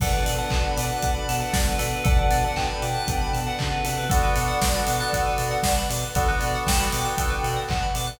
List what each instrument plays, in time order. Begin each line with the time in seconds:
0.00 synth bass 2 B1, pad 5 (bowed) B3 D4 F#4 A4, tubular bells A4, electric piano 2 B4 D5 F#5 A5, ocarina D5 F#5, kick, crash
0.13 tubular bells B4, electric piano 2 B4 D5 F#5 A5
0.25 synth bass 2 B2, tubular bells D5, open hi-hat
0.38 electric piano 2 B4 D5 F#5 A5, tubular bells F#5
0.50 synth bass 2 B1, tubular bells A5, kick, clap
0.64 tubular bells B5
0.76 synth bass 2 B2, electric piano 2 B4 D5 F#5 A5, tubular bells D6, open hi-hat
0.90 tubular bells F#6
1.02 synth bass 2 B1, electric piano 2 B4 D5 F#5 A5, tubular bells D6, kick, closed hi-hat
1.15 tubular bells B5
1.28 synth bass 2 B2, tubular bells A5, open hi-hat
1.40 electric piano 2 B4 D5 F#5 A5, tubular bells F#5
1.53 synth bass 2 B1, tubular bells D5, kick, snare
1.67 tubular bells B4
1.79 synth bass 2 B2, tubular bells A4, electric piano 2 B4 D5 F#5 A5, open hi-hat
1.92 tubular bells B4
2.04 synth bass 2 B1, pad 5 (bowed) B3 D4 F#4 A4, tubular bells A4, electric piano 2 B4 D5 F#5 A5, ocarina D5 F#5, kick, closed hi-hat
2.18 tubular bells B4, electric piano 2 B4 D5 F#5 A5
2.30 synth bass 2 B2, tubular bells D5, open hi-hat
2.43 electric piano 2 B4 D5 F#5 A5, tubular bells F#5
2.56 synth bass 2 B1, ocarina G5, tubular bells A5, kick, clap
2.69 tubular bells B5
2.82 synth bass 2 B2, electric piano 2 B4 D5 F#5 A5, tubular bells D6, open hi-hat
2.95 tubular bells F#6
3.07 synth bass 2 B1, electric piano 2 B4 D5 F#5 A5, tubular bells D6, kick, closed hi-hat
3.21 tubular bells B5
3.33 synth bass 2 B2, tubular bells A5, open hi-hat
3.46 electric piano 2 B4 D5 F#5 A5, tubular bells F#5
3.59 synth bass 2 C#3, tubular bells D5, ocarina F#5, kick, clap
3.72 tubular bells B4
3.84 synth bass 2 C3, tubular bells A4, electric piano 2 B4 D5 F#5 A5, open hi-hat
3.98 tubular bells B4
4.09 synth bass 2 B1, electric piano 2 B3 D4 F#4 A4, tubular bells A4, pad 5 (bowed) B4 D5 F#5 A5, ocarina D5 F#5, kick, closed hi-hat
4.23 electric piano 2 B3 D4 F#4 A4, tubular bells B4
4.36 synth bass 2 B2, tubular bells D5, open hi-hat
4.48 tubular bells F#5
4.61 synth bass 2 B1, tubular bells A5, kick, snare
4.75 electric piano 2 B3 D4 F#4 A4, tubular bells B5
4.87 synth bass 2 B2, tubular bells D6, open hi-hat
5.00 electric piano 2 B3 D4 F#4 A4, tubular bells F#6
5.13 synth bass 2 B1, electric piano 2 B3 D4 F#4 A4, tubular bells A4, kick, closed hi-hat
5.26 tubular bells B4
5.38 synth bass 2 B2, tubular bells D5, open hi-hat
5.51 tubular bells F#5
5.63 synth bass 2 B1, tubular bells A5, kick, snare
5.78 tubular bells B5
5.89 synth bass 2 B2, tubular bells D6, open hi-hat
6.02 tubular bells F#6
6.15 synth bass 2 B1, electric piano 2 B3 D4 F#4 A4, tubular bells A4, pad 5 (bowed) B4 D5 F#5 A5, ocarina D5 F#5, kick, closed hi-hat
6.28 electric piano 2 B3 D4 F#4 A4, tubular bells B4
6.40 synth bass 2 B2, tubular bells D5, open hi-hat
6.55 tubular bells F#5
6.66 synth bass 2 B1, ocarina G5, tubular bells A5, kick, snare
6.79 electric piano 2 B3 D4 F#4 A4, tubular bells B5
6.92 synth bass 2 B2, tubular bells D6, open hi-hat
7.04 electric piano 2 B3 D4 F#4 A4, tubular bells F#6
7.17 synth bass 2 B1, electric piano 2 B3 D4 F#4 A4, tubular bells A4, kick, closed hi-hat
7.30 tubular bells B4
7.43 synth bass 2 B2, tubular bells D5, open hi-hat
7.56 tubular bells F#5
7.68 synth bass 2 B1, ocarina F#5, tubular bells A5, kick, clap
7.83 tubular bells B5
7.95 synth bass 2 B2, tubular bells D6, open hi-hat
8.07 tubular bells F#6